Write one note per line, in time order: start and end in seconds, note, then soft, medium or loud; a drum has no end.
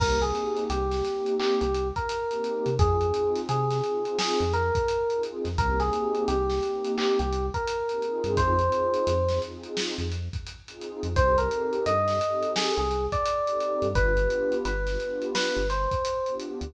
0.00 0.32 C2 medium
0.00 0.17 A#3 medium
0.00 0.17 C4 medium
0.00 0.17 D#4 medium
0.00 0.17 G4 medium
0.00 0.20 A#4 medium
0.00 kick loud
0.00 crash loud
0.22 0.76 A#3 medium
0.22 0.76 C4 medium
0.22 0.76 D#4 medium
0.22 0.76 G4 medium
0.22 0.64 G#4 medium
0.22 closed hi-hat medium
0.35 closed hi-hat medium
0.57 closed hi-hat medium
0.70 1.02 C2 medium
0.70 1.35 G4 medium
0.70 closed hi-hat loud
0.91 1.03 A#3 medium
0.91 1.03 C4 medium
0.91 1.03 D#4 medium
0.91 1.03 G4 medium
0.91 snare medium
0.91 closed hi-hat medium
1.05 1.65 A#3 medium
1.05 1.65 C4 medium
1.05 1.65 D#4 medium
1.05 1.65 G4 medium
1.05 snare soft
1.05 closed hi-hat medium
1.26 closed hi-hat medium
1.40 1.60 G4 medium
1.40 clap loud
1.61 1.92 C2 medium
1.61 1.88 G4 medium
1.61 closed hi-hat medium
1.74 closed hi-hat medium
1.96 2.74 A#4 medium
1.96 kick medium
1.96 closed hi-hat medium
2.09 closed hi-hat loud
2.29 2.69 A#3 medium
2.29 2.69 C4 medium
2.29 2.69 D#4 medium
2.29 2.69 G4 medium
2.29 closed hi-hat medium
2.44 closed hi-hat medium
2.66 2.78 C3 medium
2.66 closed hi-hat medium
2.79 3.11 F2 medium
2.79 2.97 C4 medium
2.79 2.97 D#4 medium
2.79 2.97 F4 medium
2.79 3.41 G#4 medium
2.79 2.97 G#4 loud
2.79 kick loud
2.79 closed hi-hat loud
3.01 3.53 C4 medium
3.01 3.53 D#4 medium
3.01 3.53 F4 medium
3.01 3.53 G#4 medium
3.01 closed hi-hat medium
3.14 closed hi-hat medium
3.35 snare soft
3.35 closed hi-hat medium
3.49 3.81 C3 medium
3.49 4.17 G#4 medium
3.49 closed hi-hat loud
3.70 3.80 C4 medium
3.70 3.80 D#4 medium
3.70 3.80 F4 medium
3.70 3.80 G#4 medium
3.70 snare soft
3.70 closed hi-hat medium
3.84 4.43 C4 medium
3.84 4.43 D#4 medium
3.84 4.43 F4 medium
3.84 4.43 G#4 medium
3.84 closed hi-hat medium
4.05 closed hi-hat medium
4.19 4.52 G#4 medium
4.19 snare loud
4.40 4.71 F2 medium
4.40 closed hi-hat medium
4.53 5.22 A#4 medium
4.53 closed hi-hat medium
4.75 kick medium
4.75 closed hi-hat medium
4.88 closed hi-hat loud
5.10 5.50 C4 medium
5.10 5.50 D#4 medium
5.10 5.50 F4 medium
5.10 5.50 G#4 medium
5.10 closed hi-hat medium
5.23 closed hi-hat medium
5.45 5.57 F2 medium
5.45 snare soft
5.45 closed hi-hat medium
5.58 5.90 C2 loud
5.58 5.75 A#3 medium
5.58 5.75 C4 loud
5.58 5.75 D#4 medium
5.58 5.75 G4 medium
5.58 5.79 A#4 medium
5.58 kick medium
5.58 closed hi-hat loud
5.80 6.34 A#3 medium
5.80 6.34 C4 medium
5.80 6.34 D#4 medium
5.80 6.34 G4 medium
5.80 6.24 G#4 medium
5.80 snare soft
5.80 closed hi-hat medium
5.93 closed hi-hat medium
6.15 closed hi-hat medium
6.28 6.60 C2 medium
6.28 6.91 G4 medium
6.28 closed hi-hat loud
6.48 6.58 A#3 medium
6.48 6.58 C4 medium
6.48 6.58 D#4 medium
6.48 6.58 G4 medium
6.48 snare medium
6.62 7.22 A#3 medium
6.62 7.22 C4 medium
6.62 7.22 D#4 medium
6.62 7.22 G4 medium
6.62 closed hi-hat medium
6.84 closed hi-hat medium
6.98 7.18 G4 medium
6.98 clap loud
7.19 7.50 C2 medium
7.19 7.46 G4 medium
7.19 closed hi-hat medium
7.33 closed hi-hat medium
7.54 8.32 A#4 medium
7.54 kick medium
7.54 closed hi-hat medium
7.67 closed hi-hat loud
7.89 8.03 A#3 medium
7.89 8.01 C4 medium
7.89 8.01 D#4 medium
7.89 8.03 G4 medium
7.89 closed hi-hat medium
8.02 8.54 C4 medium
8.02 8.54 D#4 loud
8.02 8.54 F4 medium
8.02 8.54 G#4 loud
8.02 closed hi-hat medium
8.24 8.36 G2 medium
8.24 closed hi-hat medium
8.37 8.69 F2 medium
8.37 9.39 C5 medium
8.37 kick loud
8.37 closed hi-hat loud
8.59 9.11 C4 medium
8.59 9.11 D#4 medium
8.59 9.11 F4 medium
8.59 9.11 G#4 medium
8.59 closed hi-hat medium
8.72 closed hi-hat medium
8.94 closed hi-hat medium
9.07 9.39 F2 medium
9.07 closed hi-hat loud
9.28 9.41 C4 medium
9.28 9.41 D#4 medium
9.28 9.41 F4 medium
9.28 9.41 G#4 medium
9.28 snare medium
9.28 closed hi-hat medium
9.42 10.02 C4 medium
9.42 10.02 D#4 medium
9.42 10.02 F4 medium
9.42 10.02 G#4 medium
9.42 closed hi-hat medium
9.63 closed hi-hat medium
9.77 snare loud
9.98 10.29 F2 medium
9.98 closed hi-hat medium
10.12 closed hi-hat medium
10.33 kick medium
10.33 closed hi-hat medium
10.47 closed hi-hat medium
10.68 11.08 C4 medium
10.68 11.08 D#4 medium
10.68 11.08 F4 medium
10.68 11.08 G#4 medium
10.68 closed hi-hat medium
10.81 closed hi-hat medium
11.03 11.15 F2 medium
11.03 closed hi-hat medium
11.15 11.48 C2 medium
11.15 11.33 C4 medium
11.15 11.33 D#4 loud
11.15 11.33 G4 medium
11.15 11.33 A4 medium
11.15 11.37 C5 loud
11.15 kick loud
11.15 closed hi-hat loud
11.38 11.91 C4 medium
11.38 11.91 D#4 medium
11.38 11.91 G4 medium
11.38 11.91 A4 medium
11.38 11.83 A#4 medium
11.38 closed hi-hat medium
11.51 closed hi-hat medium
11.73 closed hi-hat medium
11.86 12.18 G2 medium
11.86 12.51 D#5 medium
11.86 closed hi-hat loud
12.07 12.18 C4 medium
12.07 12.18 D#4 medium
12.07 12.18 G4 medium
12.07 12.18 A4 medium
12.07 snare medium
12.07 closed hi-hat medium
12.21 12.82 C4 medium
12.21 12.82 D#4 medium
12.21 12.82 G4 medium
12.21 12.82 A4 medium
12.21 closed hi-hat medium
12.43 closed hi-hat medium
12.56 12.76 G#4 medium
12.56 snare loud
12.77 13.08 C2 medium
12.77 13.06 G#4 medium
12.77 closed hi-hat medium
12.91 closed hi-hat medium
13.12 13.87 D5 medium
13.12 kick medium
13.12 closed hi-hat medium
13.26 closed hi-hat loud
13.46 13.87 C4 medium
13.46 13.87 D#4 medium
13.46 13.87 G4 medium
13.46 13.87 A4 medium
13.46 closed hi-hat medium
13.60 closed hi-hat medium
13.82 13.94 G2 medium
13.82 closed hi-hat medium
13.95 14.27 G1 loud
13.95 14.12 B3 medium
13.95 14.12 D4 loud
13.95 14.12 F4 loud
13.95 14.12 G4 medium
13.95 14.55 B4 loud
13.95 kick loud
13.95 closed hi-hat loud
14.17 14.70 B3 medium
14.17 14.70 D4 medium
14.17 14.70 F4 medium
14.17 14.70 G4 medium
14.17 closed hi-hat medium
14.30 closed hi-hat medium
14.52 closed hi-hat medium
14.65 14.97 G1 medium
14.65 15.25 B4 medium
14.65 closed hi-hat loud
14.86 14.97 B3 medium
14.86 14.97 D4 medium
14.86 14.97 F4 medium
14.86 14.97 G4 medium
14.86 snare medium
14.86 closed hi-hat medium
14.99 15.58 B3 medium
14.99 15.58 D4 medium
14.99 15.58 F4 medium
14.99 15.58 G4 medium
14.99 closed hi-hat medium
15.22 closed hi-hat medium
15.35 15.67 B4 medium
15.35 snare loud
15.56 15.87 G1 medium
15.56 closed hi-hat medium
15.70 16.34 C5 medium
15.70 snare soft
15.70 closed hi-hat medium
15.91 kick medium
15.91 closed hi-hat medium
16.05 closed hi-hat loud
16.26 16.67 B3 medium
16.26 16.67 D4 medium
16.26 16.67 F4 medium
16.26 16.67 G4 medium
16.26 closed hi-hat medium
16.40 closed hi-hat medium
16.61 16.73 D2 medium
16.61 closed hi-hat medium